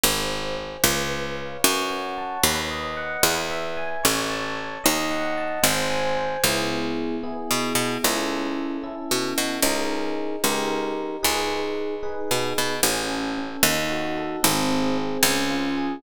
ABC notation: X:1
M:6/8
L:1/8
Q:3/8=75
K:C#m
V:1 name="Electric Piano 1"
^B g B =B c ^e | c f a B d f | B e g c a c | d f a ^B g B |
[B,EG]3 [B,EG]3 | [CEA]3 [CEA]3 | [DG^A]3 [D=GA]3 | [DGB]3 [DGB]3 |
C A C D F A | ^B, G B, C ^E G |]
V:2 name="Harpsichord" clef=bass
G,,,3 C,,3 | F,,3 D,,3 | E,,3 A,,,3 | D,,3 G,,,3 |
C,,4 B,, B,, | C,,4 B,, B,, | C,,3 C,,3 | C,,4 B,, B,, |
A,,,3 D,,3 | G,,,3 C,,3 |]